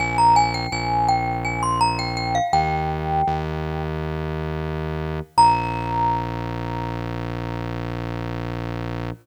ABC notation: X:1
M:7/8
L:1/16
Q:1/4=83
K:Bbdor
V:1 name="Glockenspiel"
a b a g a2 g2 a c' b g g f | "^rit." g8 z6 | b14 |]
V:2 name="Synth Bass 1" clef=bass
B,,,4 B,,,10 | "^rit." E,,4 E,,10 | B,,,14 |]